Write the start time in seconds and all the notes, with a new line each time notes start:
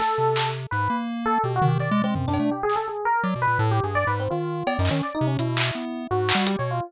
0.00 A4, snare
0.18 C3
0.36 clap
0.71 G#2 B4
0.90 A#3
1.26 A4
1.44 B2 G4
1.56 F#4
1.62 D#3, floor tom
1.68 G4
1.79 D#3 D5
1.91 G#3
2.04 G#3 C4
2.15 F#2, floor tom
2.28 F#2 D4
2.34 cowbell
2.40 A3
2.51 G4
2.63 G#4
2.69 clap
2.76 A4
2.88 G#4
3.05 A#4
3.23 F#3 D5
3.35 B2
3.42 B4
3.47 A#2
3.59 A2 A4
3.71 G4
3.83 G2 G#4
3.95 D5
4.07 G#2 B4
4.20 C4
4.30 D#3 F4
4.67 B3 D5, cowbell
4.79 F#2 D#4
4.85 clap
4.91 D#3 C#4
5.03 D5
5.15 D#4
5.21 C3
5.27 C#4
5.39 B2 E4, closed hi-hat
5.57 clap
5.75 B3
6.11 G#2 F#4
6.29 clap
6.35 G3
6.47 G4, closed hi-hat
6.59 B2 C#5
6.71 F4